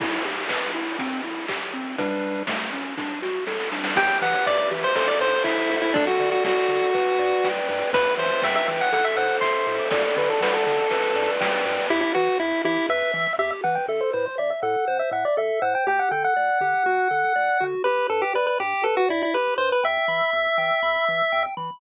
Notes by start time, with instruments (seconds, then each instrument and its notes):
0.00 lead 1 (square) E4, kick, crash
0.25 lead 1 (square) G4
0.49 lead 1 (square) B4, kick, clap
0.74 lead 1 (square) E4
0.99 lead 1 (square) C4, kick, closed hi-hat
1.24 lead 1 (square) E4
1.48 lead 1 (square) G4, kick, clap
1.74 lead 1 (square) C4
1.98 lead 1 (square) G3 D4 B4, kick, closed hi-hat
2.47 lead 1 (square) A3, kick, snare
2.73 lead 1 (square) C#4
2.98 lead 1 (square) D4, kick, snare
3.22 lead 1 (square) F#4, snare
3.47 lead 1 (square) A4, snare
3.60 snare
3.72 lead 1 (square) D4, snare
3.84 snare
3.96 synth bass 1 E2, lead 1 (square) G4 G5, kick, crash
4.21 synth bass 1 E3, lead 1 (square) B4 F#5, ride
4.46 synth bass 1 E2, lead 1 (square) D5 E5, kick, clap
4.58 lead 1 (square) D5
4.71 synth bass 1 E3, lead 1 (square) G4, ride
4.84 lead 1 (square) C5
4.95 synth bass 1 A1, lead 1 (square) A4 C5, kick, ride
5.08 lead 1 (square) D5
5.20 synth bass 1 A2, lead 1 (square) C5, ride
5.44 synth bass 1 A1, lead 1 (square) E4 E5, kick, clap
5.70 synth bass 1 D2, lead 1 (square) A4, ride
5.82 lead 1 (square) E4
5.94 lead 1 (square) D4 A4, kick, ride
6.07 lead 1 (square) F#4
6.20 synth bass 1 D3, lead 1 (square) D5, ride
6.32 lead 1 (square) F#4
6.44 synth bass 1 D2, lead 1 (square) F#4 F#5, kick, snare
6.68 synth bass 1 D3, lead 1 (square) A4, ride
6.94 synth bass 1 G1, lead 1 (square) B4, kick, ride
7.19 synth bass 1 G2, lead 1 (square) D5, ride
7.44 synth bass 1 G1, lead 1 (square) G5, kick, snare
7.68 synth bass 1 G2, lead 1 (square) B4, ride
7.93 synth bass 1 E2, lead 1 (square) B4, kick, ride
8.18 synth bass 1 E3, lead 1 (square) C5 E5, ride
8.42 synth bass 1 E2, lead 1 (square) E5 G5, kick, snare
8.56 lead 1 (square) E5
8.67 synth bass 1 E3, lead 1 (square) B4, ride
8.81 lead 1 (square) F#5
8.93 synth bass 1 A1, lead 1 (square) A4 F#5, kick, ride
9.04 lead 1 (square) E5
9.17 synth bass 1 A2, lead 1 (square) C5 F#5, ride
9.41 synth bass 1 A1, lead 1 (square) E5 C6, kick, clap
9.67 synth bass 1 A2, lead 1 (square) A4, ride
9.79 lead 1 (square) D6
9.91 synth bass 1 D2, lead 1 (square) A4 D5, kick, ride
10.04 lead 1 (square) D5
10.17 synth bass 1 D3, lead 1 (square) B4 D5, ride
10.30 lead 1 (square) A4
10.41 synth bass 1 D2, lead 1 (square) B4 F#5, kick, snare
10.54 lead 1 (square) A4
10.66 synth bass 1 D3, lead 1 (square) A4, ride
10.90 synth bass 1 G1, lead 1 (square) B4, kick, ride
11.16 synth bass 1 G2, lead 1 (square) D5, ride
11.40 synth bass 1 G1, lead 1 (square) G5, kick, snare
11.65 synth bass 1 G2, lead 1 (square) B4, ride
11.90 synth bass 1 E2, lead 1 (square) E4 G4
12.01 lead 1 (square) E4
12.15 synth bass 1 E3, lead 1 (square) F#4 B4
12.39 synth bass 1 E2, lead 1 (square) E4 E5
12.64 synth bass 1 E3, lead 1 (square) E4 G4
12.89 synth bass 1 E2, lead 1 (square) B4 E5
13.14 synth bass 1 E3, lead 1 (square) E5
13.38 synth bass 1 E2, lead 1 (square) G4 E5
13.64 synth bass 1 E3, lead 1 (square) B4 F#5
13.75 lead 1 (square) G5
13.88 synth bass 1 A1, lead 1 (square) A4 E5
14.01 lead 1 (square) C5
14.13 synth bass 1 A2, lead 1 (square) B4 C5
14.26 lead 1 (square) C5
14.38 synth bass 1 A1, lead 1 (square) D5 E5
14.50 lead 1 (square) E5
14.63 synth bass 1 A2, lead 1 (square) A4 F#5
14.88 synth bass 1 A1, lead 1 (square) C5
14.99 lead 1 (square) E5
15.11 synth bass 1 A2, lead 1 (square) E5 F#5
15.25 lead 1 (square) D5
15.37 synth bass 1 A1, lead 1 (square) A4 E5
15.62 synth bass 1 A2, lead 1 (square) C5 F#5
15.75 lead 1 (square) G5
15.87 synth bass 1 D2, lead 1 (square) G4 G5
15.99 lead 1 (square) F#5
16.11 synth bass 1 D3, lead 1 (square) A4 G5
16.24 lead 1 (square) F#5
16.36 synth bass 1 D2, lead 1 (square) D5
16.61 synth bass 1 D3, lead 1 (square) G4
16.86 synth bass 1 D2, lead 1 (square) F#4
17.11 synth bass 1 D3, lead 1 (square) A4
17.36 synth bass 1 D2, lead 1 (square) D5
17.60 synth bass 1 D3, lead 1 (square) F#4
17.84 synth bass 1 G1, lead 1 (square) G4 B4
18.10 synth bass 1 G2, lead 1 (square) A4 B4
18.22 lead 1 (square) G4
18.34 synth bass 1 G1, lead 1 (square) B4 D5
18.47 lead 1 (square) B4
18.60 synth bass 1 G2, lead 1 (square) G4
18.84 synth bass 1 G1, lead 1 (square) A4 B4
18.97 lead 1 (square) F#4
19.09 synth bass 1 G2, lead 1 (square) E4 D5
19.23 lead 1 (square) E4
19.34 synth bass 1 G1, lead 1 (square) G4 B4
19.58 synth bass 1 G2, lead 1 (square) B4 C5
19.72 lead 1 (square) B4
19.83 synth bass 1 E2, lead 1 (square) E5 G5
20.08 synth bass 1 E3, lead 1 (square) B5
20.33 synth bass 1 E2, lead 1 (square) E6
20.58 synth bass 1 E3, lead 1 (square) G5
20.83 synth bass 1 E2, lead 1 (square) B5
21.07 synth bass 1 E3, lead 1 (square) E6
21.32 synth bass 1 E2, lead 1 (square) G5
21.57 synth bass 1 E3, lead 1 (square) B5